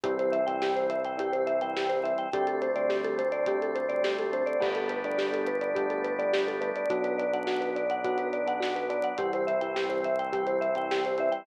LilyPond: <<
  \new Staff \with { instrumentName = "Marimba" } { \time 4/4 \key g \major \tempo 4 = 105 g'16 c''16 e''16 g''16 g'16 c''16 e''16 g''16 g'16 c''16 e''16 g''16 g'16 c''16 e''16 g''16 | g'16 a'16 c''16 d''16 g'16 a'16 c''16 d''16 g'16 a'16 c''16 d''16 g'16 a'16 c''16 d''16 | g'16 a'16 b'16 d''16 g'16 a'16 b'16 d''16 g'16 a'16 b'16 d''16 g'16 a'16 b'16 d''16 | fis'16 b'16 d''16 fis''16 fis'16 b'16 d''16 fis''16 fis'16 b'16 d''16 fis''16 fis'16 b'16 d''16 fis''16 |
g'16 c''16 e''16 g''16 g'16 c''16 e''16 g''16 g'16 c''16 e''16 g''16 g'16 c''16 e''16 g''16 | }
  \new Staff \with { instrumentName = "Electric Piano 1" } { \time 4/4 \key g \major <e g c'>8. <e g c'>4~ <e g c'>16 <e g c'>8. <e g c'>8. <e g c'>8 | <d g a c'>8. <d g a c'>4~ <d g a c'>16 <d g a c'>8. <d g a c'>8. <d g a c'>8 | <g a b d'>8. <g a b d'>4~ <g a b d'>16 <g a b d'>8. <g a b d'>8. <g a b d'>8 | <fis b d'>8. <fis b d'>4~ <fis b d'>16 <fis b d'>8. <fis b d'>8. <fis b d'>8 |
<e g c'>8. <e g c'>4~ <e g c'>16 <e g c'>8. <e g c'>8. <e g c'>8 | }
  \new Staff \with { instrumentName = "Synth Bass 1" } { \clef bass \time 4/4 \key g \major c,1 | d,1 | g,,1 | b,,1 |
c,1 | }
  \new Staff \with { instrumentName = "Drawbar Organ" } { \time 4/4 \key g \major <e g c'>1 | <d g a c'>1 | <g a b d'>1 | <fis b d'>1 |
<e g c'>1 | }
  \new DrumStaff \with { instrumentName = "Drums" } \drummode { \time 4/4 <hh bd>16 hh16 hh16 hh16 sn16 hh16 hh16 hh16 <hh bd>16 hh16 hh16 hh16 sn16 hh16 hh16 hh16 | <hh bd>16 hh16 hh16 hh16 sn16 hh16 hh16 hh16 <hh bd>16 hh16 hh16 hh16 sn16 hh16 hh16 hh16 | <cymc bd>16 hh16 hh16 hh16 sn16 hh16 hh16 hh16 <hh bd>16 hh16 hh16 hh16 sn16 hh16 hh16 hh16 | <hh bd>16 hh16 hh16 hh16 sn16 hh16 hh16 hh16 <hh bd>16 hh16 hh16 hh16 sn16 hh16 hh16 hh16 |
<hh bd>16 hh16 hh16 hh16 sn16 hh16 hh16 hh16 <hh bd>16 hh16 hh16 hh16 sn16 hh16 hh16 hh16 | }
>>